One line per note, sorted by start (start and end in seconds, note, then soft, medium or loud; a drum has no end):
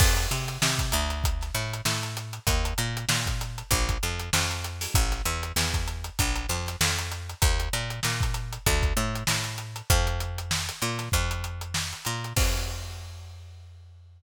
0.00 0.27 F2 loud
0.00 kick loud
0.00 crash loud
0.17 closed hi-hat medium
0.31 0.58 C3 medium
0.31 closed hi-hat medium
0.48 closed hi-hat medium
0.62 0.92 C3 medium
0.62 snare loud
0.79 kick medium
0.79 closed hi-hat medium
0.92 1.51 D2 loud
0.92 closed hi-hat loud
1.10 closed hi-hat medium
1.24 kick medium
1.24 closed hi-hat loud
1.41 snare soft
1.41 closed hi-hat medium
1.55 1.81 A2 loud
1.55 snare soft
1.55 closed hi-hat medium
1.73 closed hi-hat medium
1.85 2.39 A2 loud
1.85 snare loud
2.03 snare soft
2.03 closed hi-hat medium
2.17 closed hi-hat medium
2.33 closed hi-hat medium
2.47 2.74 D#2 loud
2.47 kick loud
2.47 closed hi-hat loud
2.65 closed hi-hat medium
2.78 3.05 A#2 loud
2.78 closed hi-hat medium
2.97 closed hi-hat medium
3.09 3.63 A#2 medium
3.09 snare loud
3.26 kick medium
3.26 closed hi-hat medium
3.41 closed hi-hat medium
3.58 closed hi-hat medium
3.71 3.98 A#1 loud
3.71 kick medium
3.71 closed hi-hat loud
3.89 kick medium
3.89 closed hi-hat medium
4.03 4.30 F2 medium
4.03 closed hi-hat medium
4.19 closed hi-hat medium
4.33 4.87 F2 loud
4.33 snare loud
4.51 closed hi-hat medium
4.64 closed hi-hat medium
4.81 snare soft
4.81 open hi-hat medium
4.94 5.22 A1 loud
4.94 kick loud
4.94 closed hi-hat loud
5.11 snare soft
5.11 closed hi-hat medium
5.25 5.52 E2 loud
5.25 closed hi-hat medium
5.43 closed hi-hat medium
5.56 6.10 E2 loud
5.56 snare loud
5.74 kick medium
5.74 closed hi-hat medium
5.88 closed hi-hat medium
6.04 closed hi-hat medium
6.19 6.46 A#1 loud
6.19 kick medium
6.19 closed hi-hat loud
6.36 closed hi-hat medium
6.49 6.76 F2 medium
6.49 snare soft
6.49 closed hi-hat medium
6.66 snare soft
6.66 closed hi-hat medium
6.81 7.34 F2 loud
6.81 snare loud
6.98 snare soft
6.98 closed hi-hat medium
7.12 closed hi-hat medium
7.30 closed hi-hat medium
7.42 7.69 D#2 loud
7.42 kick loud
7.42 closed hi-hat loud
7.60 closed hi-hat medium
7.73 8.00 A#2 loud
7.73 closed hi-hat medium
7.90 closed hi-hat medium
8.03 8.58 A#2 medium
8.03 snare loud
8.21 kick medium
8.21 closed hi-hat medium
8.34 closed hi-hat medium
8.53 closed hi-hat medium
8.66 8.93 D2 loud
8.66 kick loud
8.66 closed hi-hat loud
8.82 kick medium
8.82 closed hi-hat medium
8.97 9.24 A2 loud
8.97 closed hi-hat medium
9.15 closed hi-hat medium
9.27 9.82 A2 medium
9.27 snare loud
9.44 closed hi-hat medium
9.58 closed hi-hat medium
9.76 closed hi-hat medium
9.90 10.70 F2 loud
9.90 kick loud
9.90 closed hi-hat loud
10.07 closed hi-hat medium
10.20 closed hi-hat medium
10.38 closed hi-hat medium
10.51 snare loud
10.69 closed hi-hat medium
10.82 11.09 A#2 loud
10.82 closed hi-hat medium
10.99 snare soft
10.99 closed hi-hat medium
11.12 11.94 F2 loud
11.12 kick medium
11.12 closed hi-hat loud
11.31 closed hi-hat medium
11.44 closed hi-hat medium
11.61 closed hi-hat medium
11.74 snare loud
11.93 closed hi-hat medium
12.05 12.33 A#2 medium
12.05 closed hi-hat medium
12.24 closed hi-hat medium
12.36 14.22 F2 loud
12.36 kick loud
12.36 crash loud